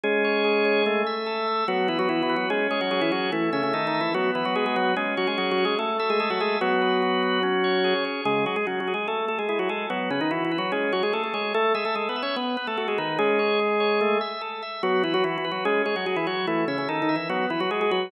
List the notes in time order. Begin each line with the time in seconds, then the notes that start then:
0.04 G#3 C#4 G#4
0.24 C#5
0.44 G#4
0.65 C#5
0.86 A3
1.07 E5
1.26 A4
1.48 E5
1.68 F#3 B3 F#4
1.88 E3 E4 B4
1.99 F#3 F#4
2.09 E3 E4 F#4
2.23 E3 E4
2.29 B4
2.36 F#3 F#4
2.50 G#3 C#4 G#4
2.71 G#3 G#4 C#5
2.81 F#3 F#4
2.91 F#3 F#4 G#4
3.01 E3 E4
3.12 F#3 F#4 C#5
3.32 E3 A3 E4
3.53 C#3 C#4 E5
3.63 C#3 C#4
3.73 D#3 D#4 A4
3.87 D#3 D#4
3.94 E5
4.01 E3 E4
4.14 F#3 B3 F#4
4.35 E3 E4 B4
4.45 F#3 F#4
4.55 G#3 F#4 G#4
4.66 G#3 G#4
4.76 F#3 F#4 B4
4.96 G#3 C#4 G#4
5.17 F#3 F#4 C#5
5.27 G#3 G#4
5.38 F#3 F#4 G#4
5.51 F#3 F#4
5.58 C#5
5.65 G#3 G#4
5.79 A3 A4
5.99 A3 A4 E5
6.10 G#3 G#4
6.20 G#3 G#4 A4
6.30 F#3 F#4
6.40 G#3 G#4 E5
6.61 F#3 B3 F#4
6.82 B4
7.02 F#4
7.23 B4
7.43 C#4
7.64 C#5
7.84 G#4
8.05 C#5
8.25 C#3 G#3 G#4
8.46 F#3 F#4 G#4
8.56 G#3 G#4
8.67 F#3 C#4 F#4
8.80 F#3 F#4
8.88 G#4
8.94 G#3 G#4
9.08 A3 A4
9.28 A3 A4
9.39 G#3 G#4
9.49 G#3 E4 G#4
9.59 F#3 F#4
9.69 G#3 G#4 A4
9.90 F#3 B3 F#4
10.11 C#3 C#4 B4
10.21 D#3 D#4
10.31 E3 E4 F#4
10.45 E3 E4
10.51 B4
10.58 F#3 F#4
10.72 G#3 C#4 G#4
10.92 F#3 F#4 C#5
11.03 G#3 G#4
11.13 A3 G#4 A4
11.23 A3 A4
11.34 G#3 G#4 C#5
11.54 A3 A4
11.75 G#3 G#4 E5
11.85 A3 A4
11.95 G#3 G#4 A4
12.09 B3 B4
12.16 E5
12.23 C#4 C#5
12.36 B3 B4
12.57 B3 B4
12.67 A3 A4
12.77 A3 F#4 A4
12.88 G#3 G#4
12.98 D#3 D#4 B4
13.18 G#3 C#4 G#4
13.39 C#5
13.60 G#4
13.80 C#5
14.01 A3
14.21 E5
14.41 A4
14.63 E5
14.83 F#3 B3 F#4
15.04 E3 E4 B4
15.14 F#3 F#4
15.24 E3 E4 F#4
15.38 E3 E4
15.44 B4
15.52 F#3 F#4
15.65 G#3 C#4 G#4
15.86 G#3 G#4 C#5
15.96 F#3 F#4
16.06 F#3 F#4 G#4
16.16 E3 E4
16.27 F#3 F#4 C#5
16.47 E3 A3 E4
16.68 C#3 C#4 E5
16.78 C#3 C#4
16.89 D#3 D#4 A4
17.02 D#3 D#4
17.09 E5
17.16 E3 E4
17.29 F#3 B3 F#4
17.50 E3 E4 B4
17.60 F#3 F#4
17.71 G#3 F#4 G#4
17.81 G#3 G#4
17.91 F#3 F#4 B4